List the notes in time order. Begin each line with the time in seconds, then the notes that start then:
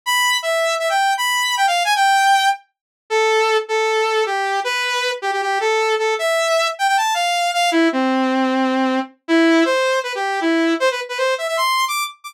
0.06 B5
0.43 E5
0.79 E5
0.90 G5
1.18 B5
1.57 G5
1.67 F5
1.85 G#5
1.96 G5
3.10 A4
3.69 A4
4.26 G4
4.64 B4
5.22 G4
5.33 G4
5.42 G4
5.60 A4
5.99 A4
6.19 E5
6.79 G5
6.88 G5
6.97 A5
7.14 F5
7.54 F5
7.71 E4
7.92 C4
9.28 E4
9.65 C5
10.03 B4
10.15 G4
10.41 E4
10.80 C5
10.91 B4
11.09 B4
11.18 C5
11.38 E5
11.48 E5
11.57 C6
11.88 D6
12.24 D6